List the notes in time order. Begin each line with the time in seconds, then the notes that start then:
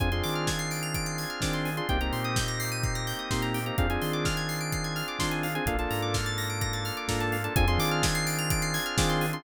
0.00 F2 C4 D4 F4 G#4 G#5, kick, closed hi-hat
0.12 C4 D4 F4 G#4 C6, closed hi-hat
0.23 D#3 D6, open hi-hat
0.35 F6, closed hi-hat
0.47 G#6, kick, snare
0.59 C7, closed hi-hat
0.71 D7, open hi-hat
0.82 F7, closed hi-hat
0.94 D7, kick, closed hi-hat
1.06 C7, closed hi-hat
1.18 G#6, open hi-hat
1.30 F6, closed hi-hat
1.40 D#3 C4 D4 F4 G#4 D6, kick, snare
1.53 C6, closed hi-hat
1.65 G#5, open hi-hat
1.77 C4 D4 F4 G#4 C6, closed hi-hat
1.88 C2 A#3 C4 D#4 G4 G5, kick, closed hi-hat
2.00 A#3 C4 D#4 G4 A#5, closed hi-hat
2.13 A#2 C6, open hi-hat
2.24 D#6, closed hi-hat
2.36 G6, kick, snare
2.48 A#6, closed hi-hat
2.60 C7, open hi-hat
2.71 D#7, closed hi-hat
2.83 C7, kick, closed hi-hat
2.95 A#6, closed hi-hat
3.07 G6, open hi-hat
3.19 D#6, closed hi-hat
3.31 A#2 A#3 C4 D#4 G4 C6, kick, snare
3.42 A#5, closed hi-hat
3.54 G5, open hi-hat
3.66 A#3 C4 D#4 G4 A#5, closed hi-hat
3.77 F2 C4 D4 F4 G#4 F5, kick, closed hi-hat
3.90 C4 D4 F4 G#4 G#5, closed hi-hat
4.02 D#3 C6, open hi-hat
4.13 D6, closed hi-hat
4.25 F6, kick, snare
4.37 G#6, closed hi-hat
4.49 C7, open hi-hat
4.60 D7, closed hi-hat
4.72 C7, kick, closed hi-hat
4.84 G#6, closed hi-hat
4.96 F6, open hi-hat
5.08 D6, closed hi-hat
5.19 D#3 C4 D4 F4 G#4 C6, kick, snare
5.31 G#5, closed hi-hat
5.43 F5, open hi-hat
5.55 C4 D4 F4 G#4 G#5, closed hi-hat
5.66 A#1 A#3 D4 F4 A4 F5, kick, closed hi-hat
5.78 A#3 D4 F4 A4 A5, closed hi-hat
5.90 G#2 A#5, open hi-hat
6.02 D6, closed hi-hat
6.14 F6, kick, snare
6.26 A6, closed hi-hat
6.38 A#6, open hi-hat
6.50 D7, closed hi-hat
6.61 A#6, kick, closed hi-hat
6.73 A6, closed hi-hat
6.85 F6, open hi-hat
6.97 D6, closed hi-hat
7.08 G#2 A#3 D4 F4 A4 A#5, kick, snare
7.20 A5, closed hi-hat
7.32 F5, open hi-hat
7.44 A#3 D4 F4 A4 A5, closed hi-hat
7.56 F2 C4 D4 F4 G#4 G#5, kick, closed hi-hat
7.68 C4 D4 F4 G#4 C6, closed hi-hat
7.78 D#3 D6, open hi-hat
7.91 F6, closed hi-hat
8.03 G#6, kick, snare
8.15 C7, closed hi-hat
8.26 D7, open hi-hat
8.38 F7, closed hi-hat
8.50 D7, kick, closed hi-hat
8.62 C7, closed hi-hat
8.74 G#6, open hi-hat
8.86 F6, closed hi-hat
8.98 D#3 C4 D4 F4 G#4 D6, kick, snare
9.09 C6, closed hi-hat
9.21 G#5, open hi-hat
9.33 C4 D4 F4 G#4 C6, closed hi-hat